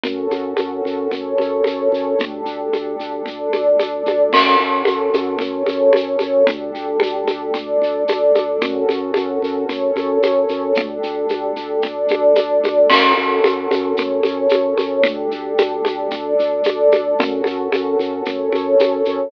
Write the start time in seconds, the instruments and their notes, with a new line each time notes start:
0.03 drawbar organ F#2, pad 5 (bowed) C#4 F#4 A4, low conga, shaker
0.31 drawbar organ F#2, high conga, shaker
0.57 drawbar organ F#2, high conga, shaker
0.85 drawbar organ F#2, shaker
1.11 drawbar organ F#2, pad 5 (bowed) C#4 A4 C#5, low conga, shaker
1.38 drawbar organ F#2, high conga, shaker
1.64 drawbar organ F#2, high conga, shaker
1.92 drawbar organ F#2, shaker
2.19 drawbar organ D2, pad 5 (bowed) D4 G4 A4, low conga, shaker
2.46 drawbar organ D2, shaker
2.73 drawbar organ D2, high conga, shaker
2.99 drawbar organ D2, shaker
3.26 drawbar organ D2, pad 5 (bowed) D4 A4 D5, low conga, shaker
3.53 drawbar organ D2, high conga, shaker
3.79 drawbar organ D2, high conga, shaker
4.06 drawbar organ D2, high conga, shaker
4.33 drawbar organ F#2, pad 5 (bowed) C#4 F#4 A4, crash, low conga, shaker
4.59 drawbar organ F#2, shaker
4.85 drawbar organ F#2, high conga, shaker
5.14 drawbar organ F#2, high conga, shaker
5.39 drawbar organ F#2, pad 5 (bowed) C#4 A4 C#5, low conga, shaker
5.66 drawbar organ F#2, high conga, shaker
5.93 drawbar organ F#2, high conga, shaker
6.19 drawbar organ F#2, high conga, shaker
6.47 drawbar organ D2, pad 5 (bowed) D4 G4 A4, low conga, shaker
6.75 drawbar organ D2, shaker
7.00 drawbar organ D2, high conga, shaker
7.27 drawbar organ D2, high conga, shaker
7.54 drawbar organ D2, pad 5 (bowed) D4 A4 D5, low conga, shaker
7.82 drawbar organ D2, shaker
8.08 drawbar organ D2, high conga, shaker
8.35 drawbar organ D2, high conga, shaker
8.61 drawbar organ F#2, pad 5 (bowed) C#4 F#4 A4, low conga, shaker
8.89 drawbar organ F#2, high conga, shaker
9.14 drawbar organ F#2, high conga, shaker
9.42 drawbar organ F#2, shaker
9.69 drawbar organ F#2, pad 5 (bowed) C#4 A4 C#5, low conga, shaker
9.96 drawbar organ F#2, high conga, shaker
10.23 drawbar organ F#2, high conga, shaker
10.49 drawbar organ F#2, shaker
10.75 drawbar organ D2, pad 5 (bowed) D4 G4 A4, low conga, shaker
11.03 drawbar organ D2, shaker
11.29 drawbar organ D2, high conga, shaker
11.56 drawbar organ D2, shaker
11.82 drawbar organ D2, pad 5 (bowed) D4 A4 D5, low conga, shaker
12.08 drawbar organ D2, high conga, shaker
12.35 drawbar organ D2, high conga, shaker
12.64 drawbar organ D2, high conga, shaker
12.90 drawbar organ F#2, pad 5 (bowed) C#4 F#4 A4, crash, low conga, shaker
13.17 drawbar organ F#2, shaker
13.44 drawbar organ F#2, high conga, shaker
13.71 drawbar organ F#2, high conga, shaker
13.97 drawbar organ F#2, pad 5 (bowed) C#4 A4 C#5, low conga, shaker
14.23 drawbar organ F#2, high conga, shaker
14.49 drawbar organ F#2, high conga, shaker
14.78 drawbar organ F#2, high conga, shaker
15.03 drawbar organ D2, pad 5 (bowed) D4 G4 A4, low conga, shaker
15.31 drawbar organ D2, shaker
15.58 drawbar organ D2, high conga, shaker
15.85 drawbar organ D2, high conga, shaker
16.11 drawbar organ D2, pad 5 (bowed) D4 A4 D5, low conga, shaker
16.39 drawbar organ D2, shaker
16.64 drawbar organ D2, high conga, shaker
16.92 drawbar organ D2, high conga, shaker
17.18 drawbar organ F#2, pad 5 (bowed) C#4 F#4 A4, low conga, shaker
17.44 drawbar organ F#2, high conga, shaker
17.72 drawbar organ F#2, high conga, shaker
17.99 drawbar organ F#2, shaker
18.25 drawbar organ F#2, pad 5 (bowed) C#4 A4 C#5, low conga, shaker
18.52 drawbar organ F#2, high conga, shaker
18.79 drawbar organ F#2, high conga, shaker
19.05 drawbar organ F#2, shaker